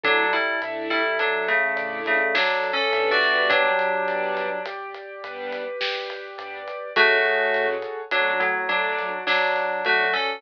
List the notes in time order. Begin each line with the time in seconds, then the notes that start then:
0.04 A1 F#3 A3 D4 E4 A4, kick, closed hi-hat
0.33 G3 E4, closed hi-hat
0.62 A2 A3 D4 E4 E5, closed hi-hat
0.90 G3 E4, closed hi-hat
1.19 A1 F#3 D4 A4, closed hi-hat
1.48 C#3 A3, closed hi-hat
1.76 A2 A3 D4 E4 D5, closed hi-hat
2.06 C#3 A3, closed hi-hat
2.35 A1 F#3 D4 A4, snare
2.64 closed hi-hat
2.73 C#4 A4
2.92 A2 G3 B3 D4 E5, closed hi-hat
3.11 F#4 D5
3.21 open hi-hat
3.49 G1 F#3 D4 G4, kick, closed hi-hat
3.79 closed hi-hat
4.08 G2 G3 B3 D4 D5, closed hi-hat
4.37 closed hi-hat
4.66 G1 G4, closed hi-hat
4.94 closed hi-hat
5.24 G2 G3 B3 D4 B4, closed hi-hat
5.52 closed hi-hat
5.81 G1 G4, snare
6.10 closed hi-hat
6.38 G2 G3 B3 D4 D5, closed hi-hat
6.68 closed hi-hat
6.96 A1 F#3 G#3 A3 C#4 F#4 G#4 A4 C#5, kick, closed hi-hat
7.25 closed hi-hat
7.54 A2 F#3 G#3 A3 C#4, closed hi-hat
7.82 closed hi-hat
8.11 F#2 F#3 A3 D4 F#4, closed hi-hat
8.40 A2 F#3, closed hi-hat
8.69 F#3 A3 D4 D5, closed hi-hat
8.99 closed hi-hat
9.27 F#2 F#3 D4 F#4, snare
9.56 closed hi-hat
9.85 F#3 A3 D4 F#4 A4, closed hi-hat
10.13 C#4 A4, open hi-hat